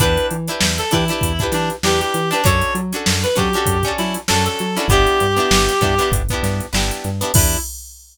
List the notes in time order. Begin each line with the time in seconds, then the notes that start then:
0.00 E2 D4 E4 G4 B4, kick, closed hi-hat
0.17 closed hi-hat
0.31 E3, closed hi-hat
0.48 D4 E4 G4 B4, closed hi-hat
0.61 E2, snare
0.78 A4, closed hi-hat
0.91 E3 D4 E4 G4 B4, kick, closed hi-hat
1.08 D4 E4 G4, closed hi-hat
1.13 B4
1.21 E2, kick, closed hi-hat
1.39 D4 E4 G4, kick, closed hi-hat
1.43 B4
1.52 E3 D4, snare, closed hi-hat
1.70 closed hi-hat
1.83 E2 D4 E4 G4, snare
1.88 B4
2.00 G4, closed hi-hat
2.14 E3, closed hi-hat
2.31 D4 E4 G4 B4, snare, closed hi-hat
2.44 F#2 C#4 D4 F#4 A4 C#5, kick, closed hi-hat
2.61 closed hi-hat
2.75 F#3, closed hi-hat
2.92 C#4 D4 F#4 A4, closed hi-hat
3.06 F#2, snare
3.23 B4, snare, closed hi-hat
3.35 F#3 C#4 D4 F#4 G4 A4, kick, snare, closed hi-hat
3.53 C#4 D4 F#4, closed hi-hat
3.58 A4
3.66 F#2, kick, closed hi-hat
3.83 C#4 D4 F#4, kick, closed hi-hat
3.88 A4
3.98 F#3 E4, snare, closed hi-hat
4.14 closed hi-hat
4.28 F#2 C#4 D4 F#4 A4, snare
4.46 A4, closed hi-hat
4.59 F#3, closed hi-hat
4.75 C#4 D4 E4 F#4, snare, closed hi-hat
4.80 A4
4.88 G1 B3 D4 E4 G4, kick, closed hi-hat
4.93 G4
5.07 closed hi-hat
5.20 G2, closed hi-hat
5.36 B3 D4 E4 G4, closed hi-hat
5.51 G1, snare
5.69 closed hi-hat
5.81 G2 B3 D4 E4 G4, kick, closed hi-hat
5.98 B3 D4 E4, snare, closed hi-hat
6.02 G4
6.11 G1, kick, closed hi-hat
6.29 B3 D4, kick, closed hi-hat
6.33 E4 G4
6.43 G2, snare, closed hi-hat
6.60 closed hi-hat
6.73 G1 B3 D4 E4 G4, snare
6.91 closed hi-hat
7.04 G2, closed hi-hat
7.21 B3 D4 E4 G4, closed hi-hat
7.34 E2 D4 E4 G4, kick, crash
7.38 B4